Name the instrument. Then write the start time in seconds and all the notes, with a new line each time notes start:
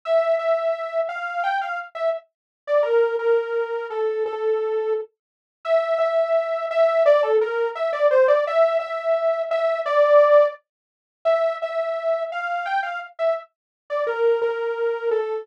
lead 2 (sawtooth)
0.05 E5
0.39 E5
1.09 F5
1.43 G5
1.61 F5
1.95 E5
2.67 D5
2.83 A#4
3.19 A#4
3.90 A4
4.26 A4
5.65 E5
5.98 E5
6.71 E5
7.06 D5
7.23 A4
7.41 A#4
7.75 E5
7.93 D5
8.11 C5
8.28 D5
8.47 E5
8.80 E5
9.51 E5
9.86 D5
11.25 E5
11.62 E5
12.32 F5
12.66 G5
12.83 F5
13.19 E5
13.90 D5
14.07 A#4
14.42 A#4
15.11 A4